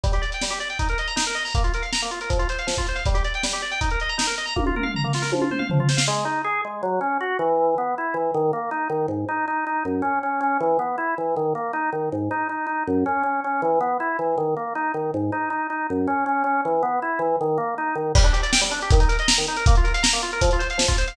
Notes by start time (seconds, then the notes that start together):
0.04 G3, kick, closed hi-hat
0.13 G4, closed hi-hat
0.22 D5, closed hi-hat
0.32 G5, closed hi-hat
0.42 G3, snare
0.50 G4, closed hi-hat
0.60 D5, closed hi-hat
0.70 G5, closed hi-hat
0.79 D#4, kick, closed hi-hat
0.89 A#4, closed hi-hat
0.98 D#5, closed hi-hat
1.08 A#5, closed hi-hat
1.16 D#4, snare
1.26 A#4, closed hi-hat
1.35 D#5, closed hi-hat
1.45 A#5, open hi-hat
1.55 A#3, kick, closed hi-hat
1.64 F4, closed hi-hat
1.74 A#4, closed hi-hat
1.82 F5, closed hi-hat
1.93 A#5, snare
2.02 A#3, closed hi-hat
2.11 F4, closed hi-hat
2.21 A#4, closed hi-hat
2.30 F3, kick, closed hi-hat
2.39 F4, closed hi-hat
2.49 C5, closed hi-hat
2.59 F5, closed hi-hat
2.67 F3, snare
2.77 F4, kick, closed hi-hat
2.87 C5, closed hi-hat
2.95 F5, closed hi-hat
3.06 G3, kick, closed hi-hat
3.14 G4, closed hi-hat
3.24 D5, closed hi-hat
3.34 G5, closed hi-hat
3.43 G3, snare
3.53 G4, closed hi-hat
3.62 D5, closed hi-hat
3.71 G5, closed hi-hat
3.81 D#4, kick, closed hi-hat
3.90 A#4, closed hi-hat
4.00 D#5, closed hi-hat
4.09 A#5, closed hi-hat
4.18 D#4, snare
4.27 A#4, closed hi-hat
4.38 D#5, closed hi-hat
4.46 A#5, closed hi-hat
4.56 A#3, kick, high tom
4.66 F4, high tom
4.75 A#4, mid tom
4.83 F5, mid tom
4.94 A#5, floor tom
5.04 A#3, floor tom
5.13 F4, snare
5.22 A#4, snare
5.32 F3, high tom
5.41 F4, high tom
5.51 C5, mid tom
5.59 F5, mid tom
5.70 F3, floor tom
5.79 F4, floor tom
5.89 C5, snare
5.97 F5, snare
6.08 G#3
6.25 D#4
6.44 G#4
6.65 G#3
6.83 F#3
7.01 C#4
7.21 F#4
7.39 E3
7.78 B3
7.98 E4
8.14 E3
8.34 D#3
8.53 A#3
8.71 D#4
8.90 D#3
9.08 G#2
9.29 D#4
9.48 D#4
9.67 D#4
9.85 F#2
10.02 C#4
10.23 C#4
10.41 C#4
10.60 E3
10.79 B3
10.98 E4
11.18 E3
11.36 D#3
11.55 A#3
11.73 D#4
11.93 D#3
12.12 G#2
12.31 D#4
12.49 D#4
12.67 D#4
12.87 F#2
13.06 C#4
13.23 C#4
13.44 C#4
13.62 E3
13.81 B3
14.00 E4
14.19 E3
14.38 D#3
14.57 A#3
14.75 D#4
14.94 D#3
15.14 G#2
15.32 D#4
15.50 D#4
15.70 D#4
15.90 F#2
16.07 C#4
16.26 C#4
16.44 C#4
16.65 E3
16.83 B3
17.02 E4
17.19 E3
17.41 D#3
17.58 A#3
17.78 D#4
17.95 D#3
18.15 G3, kick, crash
18.24 D4, closed hi-hat
18.33 G4, closed hi-hat
18.43 D5, closed hi-hat
18.52 G5, snare
18.61 G3, closed hi-hat
18.71 D4, closed hi-hat
18.81 G4, closed hi-hat
18.90 D#3, kick, closed hi-hat
19.00 D#4, closed hi-hat
19.09 A#4, closed hi-hat
19.19 D#5, closed hi-hat
19.28 A#5, snare
19.38 D#3, closed hi-hat
19.47 D#4, closed hi-hat
19.57 A#4, closed hi-hat
19.66 A#3, kick, closed hi-hat
19.75 F4, closed hi-hat
19.84 A#4, closed hi-hat
19.94 F5, closed hi-hat
20.03 A#5, snare
20.13 A#3, closed hi-hat
20.22 F4, closed hi-hat
20.32 A#4, closed hi-hat
20.41 F3, kick, closed hi-hat
20.51 F4, closed hi-hat
20.59 C5, closed hi-hat
20.70 F5, closed hi-hat
20.78 F3, snare
20.88 F4, kick, closed hi-hat
20.98 C5, closed hi-hat
21.08 F5, closed hi-hat